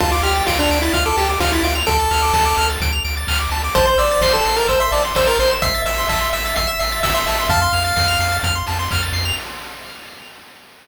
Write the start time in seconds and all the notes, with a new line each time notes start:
0.00 D2 F4 A5, kick, crash
0.11 F4 D6
0.22 D2 G4 F6, open hi-hat
0.36 A6
0.47 D2 F4 D7, kick, snare
0.59 D4 F7
0.70 D2 D7, open hi-hat
0.82 E4 A6
0.93 D2 F4 F6, kick, closed hi-hat
1.06 A4 D6
1.17 D2 G4 A5, open hi-hat
1.29 D6
1.40 D2 F4 F6, kick, snare
1.52 E4 A6
1.63 D2 F4 D7, open hi-hat
1.75 F7
1.86 D2 A4 D7, kick, closed hi-hat
2.00 A6
2.11 D2 F6, open hi-hat
2.22 D6
2.33 D2 A5, kick, snare
2.46 D6
2.57 D2 F6, open hi-hat
2.70 A6
2.81 D2 D7, kick, closed hi-hat
2.92 F7
3.04 D2 D7, open hi-hat
3.17 A6
3.27 D2 F6, kick, clap
3.40 D6
3.50 D2 A5, open hi-hat
3.64 D6
3.75 A1 C5 A5, kick, closed hi-hat
3.86 C5 C6
3.98 A1 D5 E6, open hi-hat
4.11 A6
4.21 A1 C5 C7, kick, snare
4.33 A4 E7
4.45 A1 C7, open hi-hat
4.56 A#4 A6
4.68 A1 C5 E6, kick, closed hi-hat
4.80 E5 C6
4.92 A1 D5 A5, open hi-hat
5.05 C6
5.15 A1 C5 E6, kick, snare
5.27 A#4 A6
5.39 A1 C5 C7, open hi-hat
5.51 E7
5.62 A1 E5 C7, kick, closed hi-hat
5.74 A6
5.84 A1 E5 E6, open hi-hat
5.98 C6
6.08 A1 E5 A5, kick, clap
6.21 C6
6.33 A1 E5 E6, open hi-hat
6.46 A6
6.56 A1 E5 C7, kick, closed hi-hat
6.67 E5 E7
6.79 A1 E5 C7, open hi-hat
6.92 A6
7.03 A1 E5 E6, kick, snare
7.14 E5 C6
7.26 A1 E5 A5, open hi-hat
7.39 C6
7.49 F2 F5 A5, kick, closed hi-hat
7.62 C6
7.73 F2 F6, open hi-hat
7.85 A6
7.96 F2 C7, kick, snare
8.08 F7
8.19 F2 C7, open hi-hat
8.32 A6
8.43 F2 F6, kick, closed hi-hat
8.55 C6
8.67 F2 A5, open hi-hat
8.79 C6
8.91 F2 F6, kick, clap
9.03 A6
9.13 F2 C7, open hi-hat
9.25 F7